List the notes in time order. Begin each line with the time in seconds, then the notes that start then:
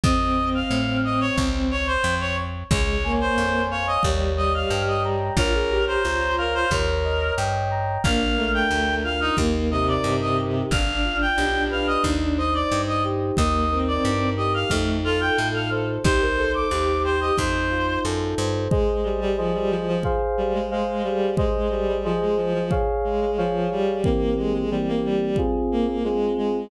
0.04 F2 C4 D#5, kick
0.55 F5
0.71 A2
1.05 D#5
1.21 C#5
1.38 C#2, kick
1.71 C#5
1.87 C5
2.04 F2
2.20 C#5
2.71 C#2 G#3 C#5, kick
3.04 A#3 G#5
3.21 C5
3.38 F2 C#5
3.71 C#5 F5
3.87 D#5
4.03 D#2 G3 C#5, kick
4.37 G3 D#5
4.54 F5
4.70 G2 G5
4.88 D#5
5.04 A#5
5.37 A#1 F4 A#4 C#5, kick
5.54 G#4
5.70 G4 A#5
5.87 C5
6.03 C#2 F4 C#5
6.38 A#4 F5
6.54 C5
6.71 D#2 A#4 C#5, kick
7.04 D#5
7.37 G2 G5
7.71 A#5
8.04 A#1 A#3 D4 F5, kick
8.37 A3 A#4
8.54 G5
8.71 D2 D4
9.04 F4 F5
9.21 D#4
9.37 D#2 A#3 D#4, kick
9.71 C3 A#4 D#5
9.88 D5
10.04 G2 D#4
10.21 D#5
10.37 G4
10.71 G1 D4 F5, kick
11.04 F4
11.21 G5
11.38 B1 G4
11.71 B4 F5
11.87 D#5
12.04 D#2 D#4, kick
12.37 C5 D#5
12.54 D5
12.71 G2 D#4
12.88 D#5
13.04 G4
13.37 D#2 A#3 D#4 D#5, kick
13.71 C4 A#4
13.88 D5
14.04 G2 D#4
14.37 G4 D#5
14.54 F5
14.70 F2 A3 D#4, kick
15.04 F4 A4
15.21 G5
15.38 A2 A4
15.54 F5
15.71 C5
16.04 C2 D#4 G4 C5, kick
16.21 A#4
16.37 A4 C5
16.54 D6
16.71 D#2 D#4 G4
17.04 G4 C5
17.21 D#5
17.37 F2 D#4 C5, kick
17.71 F4
18.04 F#2 A4
18.38 G2 C5
18.71 G#3 G#4 C5 D#5, kick
19.04 G3
19.21 G3
19.37 F3 G#4 C5 D#5
19.54 G3
19.70 F3
19.88 F3
20.03 G#4 C5 F5, kick
20.38 G3
20.53 G#3
20.71 G#3 G#4 C5 F5
21.04 G3
21.37 G#3 G#4 C5 D#5, kick
21.71 G3
21.88 G3
22.04 F3 G#4 C5 D#5
22.21 G#3
22.37 F3
22.54 F3
22.71 G#4 C#5 F5, kick
23.04 G#3
23.21 G#3
23.37 F3 G#4 C#5 F5
23.71 G3
24.04 E3 A#3 C4 G4, kick
24.37 G#3
24.54 G#3
24.71 E3 G3 A#3 C4 G4
24.88 A#3
25.04 G3
25.21 G3
25.36 C4 F4 G#4, kick
25.71 A#3
25.87 A#3
26.04 G#3 C4 F4 G#4
26.37 G#3